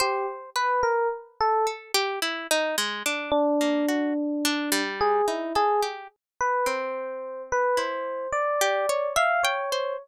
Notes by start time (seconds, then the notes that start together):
0.00 G4 C5
0.56 B4
0.83 A#4
1.40 A4
1.67 A4
1.94 G4
2.22 E4
2.51 D#4
2.78 G#3
3.06 D4
3.31 D4
3.61 A#3
3.88 F#4
4.45 D4
4.72 G3
5.01 G#4
5.28 D#4 E4
5.55 G#4 A4
5.82 G4
6.41 B4
6.66 C4 C5
7.52 B4
7.77 E4 C5
8.32 D5
8.61 G4
8.89 C#5
9.16 E5 F5
9.43 C#5 G5
9.72 C5